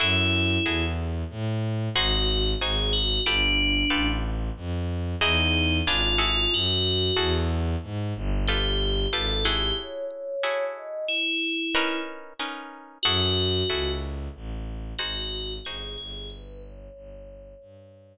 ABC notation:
X:1
M:5/4
L:1/8
Q:1/4=92
K:F#dor
V:1 name="Tubular Bells"
E3 z3 F2 G F | =D3 z3 ^D2 ^E E | F3 z3 =G2 A G | c c2 d E3 z3 |
F3 z3 F2 G G | B c5 z4 |]
V:2 name="Orchestral Harp"
[EFGA]2 [EFGA]4 [DFG^B]2 [DFGB]2 | [=F=GAB]2 [FGAB]4 [DE^F^G]2 [=D^EGB] [=EFGA]- | [EFGA]2 [EFGA]4 [=F=GAB]2 [FGAB] [E^F^GA]- | [EFGA]2 [EFGA]4 [CD^AB]2 [CDAB]2 |
[EFGA]2 [EFGA]4 [DFG^B]2 [DFGB]2 | z10 |]
V:3 name="Violin" clef=bass
F,,2 E,,2 A,,2 G,,,2 G,,,2 | =G,,,2 A,,,2 =F,,2 E,,2 ^G,,,2 | F,,2 E,,2 G,, =G,,,3 ^G,,,2 | z10 |
F,,2 C,,2 A,,,2 G,,,2 =G,,, G,,,- | =G,,,2 G,,,2 =G,,2 z4 |]